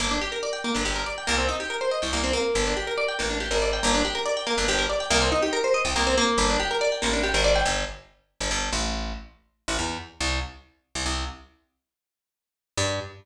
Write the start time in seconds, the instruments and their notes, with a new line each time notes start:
0.00 electric bass (finger) G1, acoustic guitar (steel) A#3
0.11 acoustic guitar (steel) D4
0.21 acoustic guitar (steel) G4
0.32 acoustic guitar (steel) A#4
0.43 acoustic guitar (steel) D5
0.53 acoustic guitar (steel) G5
0.64 acoustic guitar (steel) A#3
0.74 electric bass (finger) G1, acoustic guitar (steel) D4
0.85 electric bass (finger) G1, acoustic guitar (steel) G4
0.96 acoustic guitar (steel) A#4
1.06 acoustic guitar (steel) D5
1.18 acoustic guitar (steel) G5
1.27 electric bass (finger) C2, acoustic guitar (steel) A#3
1.38 acoustic guitar (steel) C4
1.48 acoustic guitar (steel) D#4
1.60 acoustic guitar (steel) G4
1.70 acoustic guitar (steel) A#4
1.81 acoustic guitar (steel) C5
1.91 acoustic guitar (steel) D#5
2.02 electric bass (finger) C2, acoustic guitar (steel) G5
2.13 electric bass (finger) C2, acoustic guitar (steel) A#3
2.24 acoustic guitar (steel) C4
2.33 acoustic guitar (steel) A#3
2.55 electric bass (finger) G1
2.67 acoustic guitar (steel) D4
2.77 acoustic guitar (steel) G4
2.87 acoustic guitar (steel) A#4
2.98 acoustic guitar (steel) D5
3.08 acoustic guitar (steel) G5
3.19 electric bass (finger) A1, acoustic guitar (steel) A#3
3.30 acoustic guitar (steel) D4
3.40 acoustic guitar (steel) G4
3.51 electric bass (finger) G#1, acoustic guitar (steel) A#4
3.62 acoustic guitar (steel) D5
3.73 acoustic guitar (steel) G5
3.83 electric bass (finger) G1, acoustic guitar (steel) A#3
3.94 acoustic guitar (steel) D4
4.05 acoustic guitar (steel) G4
4.15 acoustic guitar (steel) A#4
4.26 acoustic guitar (steel) D5
4.37 acoustic guitar (steel) G5
4.47 acoustic guitar (steel) A#3
4.58 electric bass (finger) G1, acoustic guitar (steel) D4
4.68 electric bass (finger) G1, acoustic guitar (steel) G4
4.78 acoustic guitar (steel) A#4
4.90 acoustic guitar (steel) D5
5.00 acoustic guitar (steel) G5
5.10 electric bass (finger) C2, acoustic guitar (steel) A#3
5.22 acoustic guitar (steel) C4
5.32 acoustic guitar (steel) D#4
5.42 acoustic guitar (steel) G4
5.53 acoustic guitar (steel) A#4
5.64 acoustic guitar (steel) C5
5.74 acoustic guitar (steel) D#5
5.85 electric bass (finger) C2, acoustic guitar (steel) G5
5.96 electric bass (finger) C2, acoustic guitar (steel) A#3
6.07 acoustic guitar (steel) C4
6.18 acoustic guitar (steel) A#3
6.38 electric bass (finger) G1
6.50 acoustic guitar (steel) D4
6.60 acoustic guitar (steel) G4
6.71 acoustic guitar (steel) A#4
6.81 acoustic guitar (steel) D5
6.92 acoustic guitar (steel) G5
7.02 electric bass (finger) A1, acoustic guitar (steel) A#3
7.13 acoustic guitar (steel) D4
7.23 acoustic guitar (steel) G4
7.34 electric bass (finger) G#1, acoustic guitar (steel) A#4
7.44 acoustic guitar (steel) D5
7.55 acoustic guitar (steel) G5
7.66 electric bass (finger) G1
8.40 electric bass (finger) G1
8.51 electric bass (finger) G1
8.73 electric bass (finger) A1
9.68 electric bass (finger) A1
9.79 electric bass (finger) E2
10.20 electric bass (finger) C2
10.95 electric bass (finger) C2
11.06 electric bass (finger) C2
12.77 electric bass (finger) G2